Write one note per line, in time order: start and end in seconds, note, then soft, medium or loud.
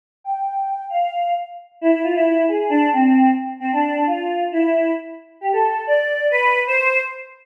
0.24 0.85 G5 medium
0.90 1.34 F5 loud
1.81 1.91 E4 loud
1.92 2.02 E4 loud
2.03 2.14 F4 loud
2.15 2.25 E4 loud
2.27 2.46 E4 loud
2.48 2.70 G#4 loud
2.70 2.89 D4 loud
2.93 3.31 C4 loud
3.60 3.71 C4 loud
3.72 4.03 D4 medium
4.07 4.44 F4 loud
4.52 4.91 E4 loud
5.41 5.52 G4 loud
5.52 5.82 A4 loud
5.87 6.27 D5 loud
6.30 6.60 B4 loud
6.67 6.99 C5 loud